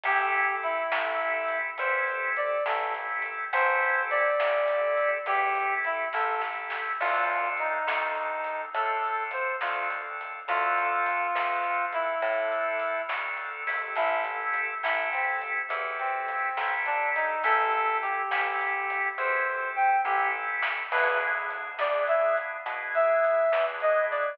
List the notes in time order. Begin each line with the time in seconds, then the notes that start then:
0.04 A1 C4 E4 G4 A4, kick, closed hi-hat
0.34 closed hi-hat
0.63 E4, closed hi-hat
0.92 A1 C4 E4 G4 A4, snare
1.21 closed hi-hat
1.48 closed hi-hat
1.78 E2 C4 E4 G4 A4 C5, kick, closed hi-hat
2.08 closed hi-hat
2.37 D5, closed hi-hat
2.66 A1 C4 E4 G4 A4, snare
2.95 closed hi-hat
3.22 closed hi-hat
3.53 A1 C4 E4 G4 A4 C5, kick, closed hi-hat
3.83 closed hi-hat
4.11 D5, closed hi-hat
4.40 A1 C4 E4 G4 A4, snare
4.68 closed hi-hat
4.97 closed hi-hat
5.26 E2 C4 E4 G4 A4, kick, closed hi-hat
5.55 closed hi-hat
5.85 E4, closed hi-hat
6.13 A1 C4 E4 G4 A4, kick, snare
6.41 snare
6.70 snare
7.01 D2 C4 D4 F4 A4, kick, crash
7.30 closed hi-hat
7.57 D#4, closed hi-hat
7.87 D2 C4 D4 F4 A4, snare
8.15 closed hi-hat
8.44 closed hi-hat
8.73 A2 C4 D4 F4 A4, kick, closed hi-hat
9.04 closed hi-hat
9.31 C5, closed hi-hat
9.61 D2 C4 D4 F4 A4, snare
9.90 closed hi-hat
10.21 closed hi-hat
10.48 D2 C4 D4 F4 A4, kick, closed hi-hat
10.78 closed hi-hat
11.06 closed hi-hat
11.35 D2 C4 D4 F4 A4, snare
11.64 closed hi-hat
11.93 E4, closed hi-hat
12.21 A2 C4 D4 F4 A4, kick, closed hi-hat
12.52 closed hi-hat
12.80 closed hi-hat
13.08 D2 C4 D4 F4 A4, snare
13.38 closed hi-hat
13.67 C4 E4 G4 A4, open hi-hat
13.96 A1 E4, kick, closed hi-hat
14.25 closed hi-hat
14.54 closed hi-hat
14.83 A1 C4 E4 G4 A4, snare
15.12 C4, closed hi-hat
15.42 closed hi-hat
15.69 E2 C4 E4 G4 A4, kick, closed hi-hat
15.99 C4, closed hi-hat
16.28 closed hi-hat
16.57 A1 C4 E4 G4 A4, snare
16.86 D4, closed hi-hat
17.15 D#4, closed hi-hat
17.43 A1 C4 E4 G4 A4, kick, closed hi-hat
17.71 closed hi-hat
18.02 G4, closed hi-hat
18.31 A1 C4 E4 G4 A4, snare
18.61 closed hi-hat
18.90 closed hi-hat
19.18 E2 C4 E4 G4 A4 C5, kick, floor tom
19.47 floor tom
19.76 G5, mid tom
20.04 A1 C4 E4 G4 A4, high tom
20.35 high tom
20.62 snare
20.92 E2 B3 D4 E4 G#4 B4, kick, crash
21.21 closed hi-hat
21.50 closed hi-hat
21.79 E2 B3 D4 E4 G#4 D5, snare
22.07 E5, closed hi-hat
22.37 closed hi-hat
22.66 B2 B3 D4 E4 G#4, kick, closed hi-hat
22.95 E5, closed hi-hat
23.24 closed hi-hat
23.52 E2 B3 D4 E4 G#4, snare
23.80 D#5, closed hi-hat
24.11 D5, closed hi-hat